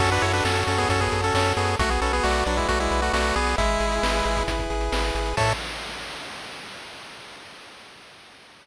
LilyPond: <<
  \new Staff \with { instrumentName = "Lead 1 (square)" } { \time 4/4 \key a \major \tempo 4 = 134 <cis' a'>16 <d' b'>16 <e' cis''>16 <d' b'>16 <cis' a'>8 <cis' a'>16 <b gis'>16 <cis' a'>16 <b gis'>8 <cis' a'>16 <cis' a'>8 <b gis'>8 | <a fis'>16 <b gis'>16 <cis' a'>16 <b gis'>16 <a fis'>8 <fis d'>16 <gis e'>16 <a fis'>16 <gis e'>8 <a fis'>16 <a fis'>8 <b gis'>8 | <gis e'>2 r2 | a'4 r2. | }
  \new Staff \with { instrumentName = "Lead 1 (square)" } { \time 4/4 \key a \major fis'8 a'8 cis''8 a'8 fis'8 a'8 cis''8 a'8 | fis'8 b'8 d''8 b'8 fis'8 b'8 d''8 b'8 | e'8 gis'8 b'8 gis'8 e'8 gis'8 b'8 gis'8 | <a' cis'' e''>4 r2. | }
  \new Staff \with { instrumentName = "Synth Bass 1" } { \clef bass \time 4/4 \key a \major fis,8 fis,8 fis,8 fis,8 fis,8 fis,8 fis,8 fis,8 | b,,8 b,,8 b,,8 b,,8 b,,8 b,,8 b,,8 b,,8 | gis,,8 gis,,8 gis,,8 gis,,8 gis,,8 gis,,8 gis,,8 gis,,8 | a,4 r2. | }
  \new DrumStaff \with { instrumentName = "Drums" } \drummode { \time 4/4 <cymc bd>16 hh16 hh16 hh16 sn16 hh16 hh16 <hh bd>16 <hh bd>16 <hh bd>16 hh16 hh16 sn16 hh16 hh16 hh16 | <hh bd>16 hh16 hh16 hh16 sn16 hh16 hh16 <hh bd>16 <hh bd>16 hh16 hh16 hh16 sn16 hh16 hh16 hho16 | <hh bd>16 hh16 hh16 hh16 sn16 hh16 hh16 <hh bd>16 <hh bd>16 <hh bd>16 hh16 hh16 sn16 hh16 hh16 hh16 | <cymc bd>4 r4 r4 r4 | }
>>